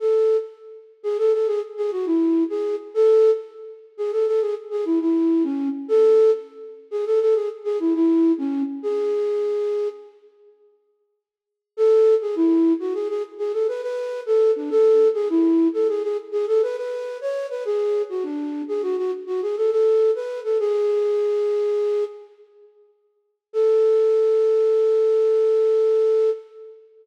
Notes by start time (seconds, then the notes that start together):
0.00 A4
1.03 G#4
1.18 A4
1.33 A4
1.47 G#4
1.77 G#4
1.91 F#4
2.06 E4
2.49 G#4
2.94 A4
3.97 G#4
4.12 A4
4.27 A4
4.41 G#4
4.70 G#4
4.85 E4
5.01 E4
5.44 C#4
5.88 A4
6.91 G#4
7.06 A4
7.20 A4
7.35 G#4
7.64 G#4
7.80 E4
7.95 E4
8.38 C#4
8.83 G#4
11.77 A4
12.21 G#4
12.36 E4
12.79 F#4
12.94 G#4
13.09 G#4
13.38 G#4
13.53 A4
13.68 B4
13.82 B4
14.26 A4
14.56 D4
14.70 A4
15.14 G#4
15.29 E4
15.73 A4
15.88 G#4
16.03 G#4
16.32 G#4
16.47 A4
16.62 B4
16.77 B4
17.21 C#5
17.50 B4
17.65 G#4
18.09 F#4
18.23 D4
18.68 G#4
18.82 F#4
18.97 F#4
19.27 F#4
19.42 G#4
19.56 A4
19.71 A4
20.15 B4
20.44 A4
20.59 G#4
23.53 A4